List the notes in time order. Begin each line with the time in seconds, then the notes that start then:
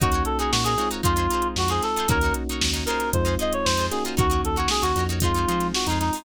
0.00 D#2 A#3 C#4 D#4 F#4 A#4 C#5, kick, closed hi-hat
0.12 D#4 F#4 A#4 C#5, closed hi-hat
0.25 A4, closed hi-hat
0.39 D#4 F#4 G#4 A#4 C#5, closed hi-hat
0.52 A#2 F#4, snare
0.64 D#4 F#4 G#4 A#4 C#5, closed hi-hat
0.78 G#3 C4 D#4 F4 F#4 A#4 C#5, closed hi-hat
0.91 D#4 F#4 A#4 C#5, closed hi-hat
1.03 F2 D#4 F4 G#4 C5, kick, closed hi-hat
1.16 D#4 F4 G#4 C5, closed hi-hat
1.30 D#4 F4 G#4, closed hi-hat
1.34 C5
1.42 closed hi-hat
1.56 F2 F#4, snare
1.68 D#4 F4 G#4 C5, closed hi-hat
1.82 A4, snare, closed hi-hat
1.96 D#4 F4 G#4 C5, closed hi-hat
2.08 D#2 A#3 C#4 D#4 F#4 A#4 C#5, kick, closed hi-hat
2.21 D#4 F#4 A#4, snare, closed hi-hat
2.26 C#5
2.34 closed hi-hat
2.49 D#4 F#4 A#4 C#5, closed hi-hat
2.61 D#2, snare
2.73 D#4 F#4 A#4 C#5, snare, closed hi-hat
2.86 D#4 F4 G#4 A#4, closed hi-hat
2.90 C5
3.00 snare, closed hi-hat
3.13 F2 G#3 C4 D#4 F4 C5, kick, closed hi-hat
3.25 D#4 F4 G#4 C5, snare, closed hi-hat
3.39 D#4 F4 G#4 C5 D#5, closed hi-hat
3.53 C#5, closed hi-hat
3.65 F2 C5, snare
3.77 D#4 F4 G#4 C5, closed hi-hat
3.91 A#3 C#4 D#4 F#4 G#4, snare, closed hi-hat
4.05 D#4 F4 G#4 C5, closed hi-hat
4.17 D#2 D#4 F#4 A#4 C#5, kick, closed hi-hat
4.30 D#4 F#4 A#4 C#5, closed hi-hat
4.43 D#2 A4, closed hi-hat
4.56 D#4 F#4 A#4 C#5, closed hi-hat
4.68 G#4, snare
4.82 D#2 D#4 F#4 A#4 C#5, closed hi-hat
4.96 F2 D#4 F#4 A#4, closed hi-hat
5.00 C#5
5.09 D#4 F#4 A#4 C#5, closed hi-hat
5.20 G#3 C4 D#4 F4 G#4, kick, closed hi-hat
5.25 C5
5.34 D#4 F4 G#4, closed hi-hat
5.38 C5
5.48 F3 D#4 F4 G#4 C5, closed hi-hat
5.60 snare, closed hi-hat
5.74 F#4, snare
5.86 F2 D#4 F4, closed hi-hat
5.91 G#4 C5
6.00 D#4, snare, closed hi-hat
6.13 D#4 F4 G#4, open hi-hat
6.18 C5